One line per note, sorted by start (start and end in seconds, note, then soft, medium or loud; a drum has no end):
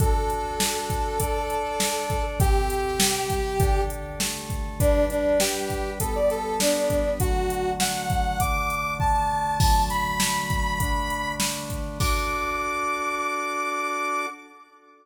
0.00 1.19 D4 medium
0.00 1.19 F#4 medium
0.00 1.19 A4 medium
0.00 2.22 A4 loud
0.00 kick loud
0.00 closed hi-hat loud
0.30 closed hi-hat medium
0.60 snare loud
0.90 kick medium
0.90 closed hi-hat medium
1.20 2.39 D4 medium
1.20 2.39 A4 medium
1.20 2.39 D5 medium
1.20 kick medium
1.20 closed hi-hat loud
1.50 closed hi-hat medium
1.80 snare loud
2.10 kick medium
2.10 closed hi-hat medium
2.40 2.99 C3 medium
2.40 2.99 C4 medium
2.40 2.99 G4 medium
2.40 3.81 G4 loud
2.40 kick loud
2.40 closed hi-hat loud
2.70 closed hi-hat medium
3.00 3.59 C3 medium
3.00 3.59 G3 medium
3.00 3.59 G4 medium
3.00 snare loud
3.30 kick medium
3.30 closed hi-hat medium
3.60 4.20 D3 medium
3.60 4.20 D4 medium
3.60 4.20 A4 medium
3.60 kick loud
3.60 closed hi-hat loud
3.90 closed hi-hat medium
4.20 4.79 D3 medium
4.20 4.79 A3 medium
4.20 4.79 A4 medium
4.20 snare loud
4.50 kick medium
4.50 closed hi-hat medium
4.80 5.99 G3 medium
4.80 5.05 D4 loud
4.80 5.99 D4 medium
4.80 5.99 B4 medium
4.80 kick loud
4.80 closed hi-hat loud
5.10 5.38 D4 loud
5.10 closed hi-hat medium
5.40 5.90 G4 loud
5.40 snare loud
5.70 kick medium
5.70 closed hi-hat medium
6.00 7.19 G3 medium
6.00 7.19 B3 medium
6.00 6.14 A4 loud
6.00 7.19 B4 medium
6.00 kick medium
6.00 closed hi-hat loud
6.15 6.30 D5 medium
6.30 6.57 A4 loud
6.30 closed hi-hat medium
6.60 7.10 D4 medium
6.60 snare loud
6.90 kick medium
6.90 closed hi-hat medium
7.20 8.38 D3 medium
7.20 8.38 F#3 medium
7.20 8.38 A3 medium
7.20 7.70 F#4 loud
7.20 kick loud
7.20 closed hi-hat loud
7.50 closed hi-hat medium
7.80 8.38 F#5 loud
7.80 snare loud
8.10 kick loud
8.10 closed hi-hat medium
8.40 9.59 D3 medium
8.40 9.59 A3 medium
8.40 9.59 D4 medium
8.40 8.93 D6 loud
8.40 kick loud
8.40 closed hi-hat loud
8.70 closed hi-hat medium
9.00 9.57 A5 loud
9.00 kick loud
9.60 10.79 D3 medium
9.60 10.79 F#3 medium
9.60 10.79 A3 medium
9.60 9.86 A5 loud
9.60 kick loud
9.60 crash loud
9.90 11.32 B5 loud
9.90 closed hi-hat medium
10.20 snare loud
10.50 kick loud
10.50 closed hi-hat medium
10.80 11.98 D3 medium
10.80 11.98 A3 medium
10.80 11.98 D4 medium
10.80 kick loud
10.80 closed hi-hat loud
11.10 closed hi-hat medium
11.40 snare loud
11.70 kick medium
11.70 closed hi-hat medium
12.00 14.26 D4 loud
12.00 14.26 F#4 medium
12.00 14.26 A4 medium
12.00 14.26 D6 loud
12.00 kick loud
12.00 crash loud